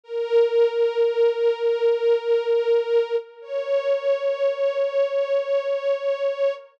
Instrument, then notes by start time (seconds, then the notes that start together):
string ensemble 1
0.04 A#4
3.42 C#5